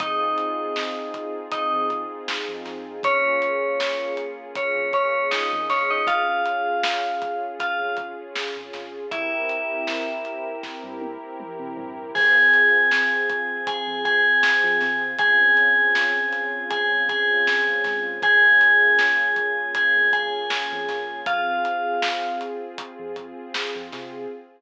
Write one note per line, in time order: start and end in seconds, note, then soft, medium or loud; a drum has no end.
0.00 0.34 F2 loud
0.00 2.99 C4 medium
0.00 1.35 D#4 medium
0.00 2.99 D#4 medium
0.00 2.99 F4 medium
0.00 2.99 G#4 medium
0.00 1.35 D#5 medium
0.00 kick loud
0.00 closed hi-hat loud
0.38 closed hi-hat medium
0.76 snare loud
1.14 kick medium
1.14 closed hi-hat medium
1.52 1.87 D#4 medium
1.52 1.87 D#5 medium
1.52 kick loud
1.52 closed hi-hat loud
1.73 2.06 F2 medium
1.90 kick medium
1.90 closed hi-hat medium
2.28 snare loud
2.49 2.64 F2 medium
2.65 3.00 F2 medium
2.65 snare medium
2.65 closed hi-hat medium
3.03 3.38 A#1 medium
3.03 6.03 A#3 medium
3.03 4.12 C#4 medium
3.03 6.03 C#4 medium
3.03 6.03 F4 medium
3.03 6.03 G#4 medium
3.03 4.12 C#5 medium
3.03 kick loud
3.03 closed hi-hat loud
3.42 closed hi-hat medium
3.80 snare loud
4.17 closed hi-hat medium
4.55 4.91 C#4 medium
4.55 4.91 C#5 medium
4.55 kick loud
4.55 closed hi-hat loud
4.76 5.10 A#1 medium
4.93 5.27 C#4 medium
4.93 5.27 C#5 medium
4.93 kick medium
4.93 closed hi-hat medium
5.31 5.65 D#4 medium
5.31 5.65 D#5 medium
5.31 snare loud
5.52 5.68 F2 medium
5.69 6.04 A#1 medium
5.69 5.89 C#4 medium
5.69 5.89 C#5 medium
5.69 kick medium
5.69 snare medium
5.69 closed hi-hat medium
5.91 6.07 D#4 medium
5.91 6.07 D#5 medium
6.07 6.42 G#1 loud
6.07 9.05 C#4 medium
6.07 9.05 F4 medium
6.07 7.43 F4 medium
6.07 9.05 G#4 medium
6.07 7.43 F5 medium
6.07 kick loud
6.07 closed hi-hat loud
6.46 closed hi-hat medium
6.83 snare loud
7.22 kick loud
7.22 closed hi-hat medium
7.60 7.96 F4 medium
7.60 7.96 F5 medium
7.60 kick medium
7.60 closed hi-hat loud
7.80 8.14 G#1 medium
7.97 kick loud
7.97 closed hi-hat medium
8.35 snare loud
8.56 8.72 G#1 medium
8.73 9.08 G#1 medium
8.73 snare medium
8.73 closed hi-hat medium
9.11 9.46 C2 medium
9.11 12.10 C4 medium
9.11 10.48 E4 medium
9.11 12.10 E4 medium
9.11 12.10 G4 medium
9.11 12.10 A#4 medium
9.11 10.48 E5 medium
9.11 kick loud
9.11 closed hi-hat loud
9.49 closed hi-hat medium
9.87 snare loud
10.25 closed hi-hat medium
10.63 kick medium
10.63 snare medium
10.84 11.17 G2 medium
11.01 high tom medium
11.40 mid tom loud
11.59 11.75 C3 medium
11.77 12.11 G2 medium
11.77 floor tom loud
12.14 12.50 F2 loud
12.14 15.12 C4 medium
12.14 15.12 F4 medium
12.14 15.12 G#4 medium
12.14 13.63 G#4 medium
12.14 13.63 G#5 medium
12.14 kick loud
12.14 crash loud
12.54 closed hi-hat medium
12.91 snare loud
13.30 kick loud
13.30 closed hi-hat medium
13.67 14.03 G#4 medium
13.67 14.03 G#5 medium
13.67 kick loud
13.67 closed hi-hat loud
13.88 14.21 F2 medium
14.05 15.02 G#4 medium
14.05 15.02 G#5 medium
14.05 kick loud
14.05 closed hi-hat medium
14.43 snare loud
14.64 14.79 F3 medium
14.81 15.16 C3 medium
14.81 snare medium
14.81 closed hi-hat medium
15.19 15.53 C#2 loud
15.19 18.17 C4 medium
15.19 18.17 C#4 medium
15.19 18.17 F4 medium
15.19 16.65 G#4 medium
15.19 18.17 G#4 medium
15.19 16.65 G#5 medium
15.19 kick loud
15.19 closed hi-hat loud
15.57 closed hi-hat medium
15.95 snare loud
16.33 snare soft
16.33 closed hi-hat medium
16.70 17.02 G#4 medium
16.70 17.02 G#5 medium
16.70 kick loud
16.70 closed hi-hat loud
16.91 17.25 C#2 medium
17.09 18.04 G#4 medium
17.09 18.04 G#5 medium
17.09 kick loud
17.09 closed hi-hat medium
17.47 snare loud
17.67 17.83 C#2 medium
17.84 18.19 G#2 medium
17.84 kick medium
17.84 snare medium
17.84 closed hi-hat medium
18.22 18.57 A#1 loud
18.22 21.20 A#3 medium
18.22 21.20 C#4 medium
18.22 21.20 F4 medium
18.22 21.20 G#4 medium
18.22 19.70 G#4 medium
18.22 19.70 G#5 medium
18.22 kick loud
18.22 closed hi-hat loud
18.61 closed hi-hat medium
18.99 snare loud
19.36 kick loud
19.36 closed hi-hat medium
19.75 20.10 G#4 medium
19.75 20.10 G#5 medium
19.75 kick medium
19.75 closed hi-hat loud
19.95 20.29 F2 medium
20.13 21.20 G#4 medium
20.13 21.20 G#5 medium
20.13 kick loud
20.13 closed hi-hat medium
20.50 snare loud
20.72 20.87 F2 medium
20.88 21.23 A#1 medium
20.88 snare medium
20.88 closed hi-hat medium
21.26 21.61 F2 loud
21.26 24.26 C4 medium
21.26 22.38 F4 medium
21.26 24.26 F4 medium
21.26 24.26 G#4 medium
21.26 22.38 F5 medium
21.26 kick loud
21.26 closed hi-hat loud
21.65 closed hi-hat medium
22.02 snare loud
22.41 closed hi-hat medium
22.78 kick loud
22.78 closed hi-hat loud
22.99 23.33 F2 medium
23.16 kick medium
23.16 closed hi-hat medium
23.54 snare loud
23.75 23.91 F2 medium
23.92 24.27 C3 medium
23.92 snare medium
23.92 closed hi-hat medium